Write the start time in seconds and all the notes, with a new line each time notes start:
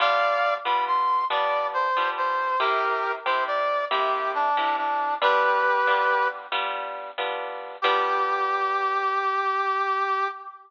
0.00 G3 B3 D4 F4 D5 F5
0.65 G3 B3 D4 F4 B5
0.87 C6
1.30 G3 B3 D4 F4 D5
1.74 C5
1.97 G3 B3 D4 F4
2.17 C5
2.60 C3 A#3 E4 G4 A#4
3.26 C3 A#3 E4 G4 C5
3.47 D5
3.91 C3 A#3 E4 G4
4.35 D4
4.57 C3 A#3 E4 G4
4.77 D4
5.22 G3 B3 D4 F4 G4 B4
5.87 G3 B3 D4 F4
6.52 G3 B3 D4 F4
7.18 G3 B3 D4 F4
7.82 G3 B3 D4 F4 G4